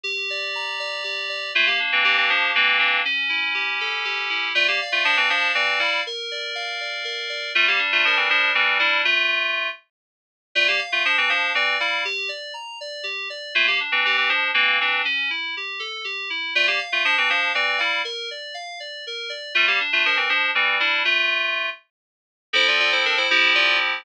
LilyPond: <<
  \new Staff \with { instrumentName = "Electric Piano 2" } { \time 6/8 \key d \minor \tempo 4. = 80 r2. | <a f'>16 <bes g'>16 r16 <e c'>16 <e c'>16 <e c'>16 <f d'>8 <e c'>8 <e c'>8 | r2. | <a f'>16 <bes g'>16 r16 <a f'>16 <f d'>16 <e c'>16 <f d'>8 <e c'>8 <g e'>8 |
r2. | <a f'>16 <bes g'>16 r16 <a f'>16 <f d'>16 <e c'>16 <f d'>8 <e c'>8 <g e'>8 | <a f'>4. r4. | <a f'>16 <bes g'>16 r16 <a f'>16 <f d'>16 <e c'>16 <f d'>8 <e c'>8 <g e'>8 |
r2. | <a f'>16 <bes g'>16 r16 <e c'>16 <e c'>16 <e c'>16 <f d'>8 <e c'>8 <e c'>8 | r2. | <a f'>16 <bes g'>16 r16 <a f'>16 <f d'>16 <e c'>16 <f d'>8 <e c'>8 <g e'>8 |
r2. | <a f'>16 <bes g'>16 r16 <a f'>16 <f d'>16 <e c'>16 <f d'>8 <e c'>8 <g e'>8 | <a f'>4. r4. | \key f \major <e' c''>16 <f' d''>16 <f' d''>16 <e' c''>16 <d' bes'>16 <e' c''>16 <e' c''>8 <f' d''>8 r8 | }
  \new Staff \with { instrumentName = "Electric Piano 2" } { \time 6/8 \key d \minor g'8 d''8 bes''8 d''8 g'8 d''8 | bes8 d'8 g'8 r8 bes8 d'8 | cis'8 e'8 g'8 a'8 g'8 e'8 | d''8 f''8 a''8 f''8 d''8 f''8 |
bes'8 d''8 f''8 d''8 bes'8 d''8 | g8 d'8 bes'8 r8 g8 d'8 | r2. | d''8 f''8 a''8 f''8 d''8 f''8 |
g'8 d''8 bes''8 d''8 g'8 d''8 | bes8 d'8 g'8 r8 bes8 d'8 | cis'8 e'8 g'8 a'8 g'8 e'8 | d''8 f''8 a''8 f''8 d''8 f''8 |
bes'8 d''8 f''8 d''8 bes'8 d''8 | g8 d'8 bes'8 r8 g8 d'8 | r2. | \key f \major <f c' a'>4. <f c' e' g'>4. | }
>>